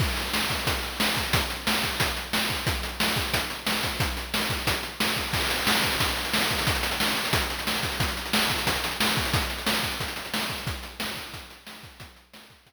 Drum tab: CC |x---------------|----------------|----------------|----------------|
HH |--x---x-x-x---x-|x-x---x-x-x---x-|x-x---x-x-x---x-|x-x---x-x-x---x-|
SD |----o-------o---|----o-------o---|----o-------o---|----o-------o---|
BD |o-----o-o-----o-|o-----o-o-----o-|o-----o-o-----o-|o-----o-o-----o-|

CC |x---------------|----------------|----------------|----------------|
HH |-xxx-xxxxxxx-xxo|xxxx-xxxxxxx-xxx|xxxx-xxxxxxx-xxx|xxxx-xxxxxxx-xxx|
SD |----o-------o---|----o-------o---|----o-------o---|----o-------o---|
BD |o-----o-o-----o-|o-------o-----o-|o-----o-o-----o-|o-----o-o-----o-|

CC |----------------|----------------|
HH |x-x---x-x-x---x-|x-x---x-x-------|
SD |----o-------o---|----o-----------|
BD |o-----o-o-----o-|o-----o-o-------|